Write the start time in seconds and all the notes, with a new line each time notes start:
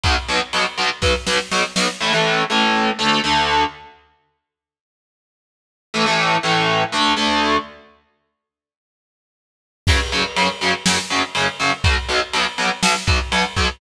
0.03 B1 B2 F#3, kick, ride
0.28 B1 B2 F#3, ride
0.53 B1 B2 F#3, ride
0.78 B1 B2 F#3, ride
1.02 B1 B2 F#3, kick, snare
1.27 B1 B2 F#3, snare
1.51 B1 B2 F#3, snare
1.76 B1 B2 F#3, snare
2.01 A2 E3 A3
2.13 A2 E3 A3
2.50 A2 E3 A3
2.99 D2 D3 A3
3.24 D2 D3 A3
5.94 A2 E3 A3
6.06 A2 E3 A3
6.43 A2 E3 A3
6.92 D2 D3 A3
7.17 D2 D3 A3
9.87 F#2 C#3 F#3, kick, crash
10.12 F#2 C#3 F#3, ride
10.36 F#2 C#3 F#3, ride
10.61 F#2 C#3 F#3, ride
10.86 F#2 C#3 F#3, snare
11.10 F#2 C#3 F#3, ride
11.35 F#2 C#3 F#3, ride
11.60 F#2 C#3 F#3, snare, ride
11.84 B1 B2 F#3, kick, ride
12.09 B1 B2 F#3, ride
12.33 B1 B2 F#3, ride
12.58 B1 B2 F#3, ride
12.83 B1 B2 F#3, snare
13.07 B1 B2 F#3, kick, ride
13.32 B1 B2 F#3, ride
13.56 B1 B2 F#3, kick, snare, ride